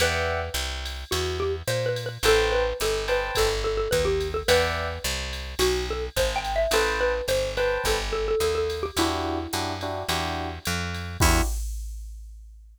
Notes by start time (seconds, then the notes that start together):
0.00 E2 B4 D5 E5 F#5 G5, ride
0.54 C2, hi-hat pedal, ride
0.86 ride
1.11 E2 F#4, ride
1.40 G4
1.68 A#2 C5, hi-hat pedal, ride
1.86 B4
1.96 ride
2.06 B4
2.23 A1 A4 B4 C5 G5 A5, ride
2.52 B4
2.80 G1 A4, hi-hat pedal, ride
3.08 B4 C5 G5 A5, ride
3.35 G1 A4, kick, ride
3.64 A4
3.77 A4
3.91 D#2 B4, kick, hi-hat pedal, ride
4.05 G4
4.20 ride
4.34 A4
4.48 E2 B4 D5 E5 F#5 G5, ride
5.04 C2, hi-hat pedal, ride
5.33 ride
5.59 B1 F#4, ride
5.90 A4
6.16 G#1 C5, kick, hi-hat pedal, ride
6.36 G5
6.45 ride
6.56 E5
6.71 A1 A4 B4 C5 G5 A5, ride
7.01 B4
7.28 G1 C5, hi-hat pedal, ride
7.57 B4 C5 G5 A5, ride
7.84 G1 A4, kick, ride
8.13 A4
8.28 A4
8.40 D#2 A4, hi-hat pedal, ride
8.55 A4
8.70 ride
8.83 G4
8.97 E2 D4 E4 F#4 G4, ride
9.53 F#2 D4 E4 F#4 G4, hi-hat pedal, ride
9.81 D4 E4 F#4 G4, ride
10.09 E2 D4 E4 F#4 G4, ride
10.65 F2, hi-hat pedal, ride
10.94 ride
11.20 E2 D4 E4 F#4 G4, kick, crash